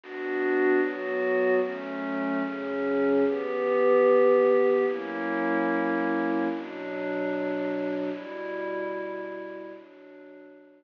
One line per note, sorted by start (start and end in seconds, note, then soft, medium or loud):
0.01 0.79 B3 medium
0.01 0.81 D4 medium
0.01 0.79 F#4 medium
0.80 1.60 F#3 medium
0.80 1.60 B3 medium
0.80 1.60 F#4 medium
1.62 2.42 F#3 medium
1.62 2.42 A3 medium
1.62 2.42 C#4 medium
2.43 3.23 C#3 medium
2.43 3.23 F#3 medium
2.43 3.23 C#4 loud
3.24 4.85 E3 medium
3.24 4.85 B3 medium
3.24 4.85 G4 medium
4.87 6.47 F#3 medium
4.87 6.47 A#3 loud
4.87 6.47 C#4 medium
4.87 6.47 E4 medium
6.49 8.10 B2 medium
6.49 8.10 F#3 medium
6.49 8.10 D4 medium
8.12 9.72 B2 medium
8.12 9.72 G3 medium
8.12 9.72 E4 medium
9.73 10.84 B2 medium
9.73 10.84 F#3 medium
9.73 10.84 D4 medium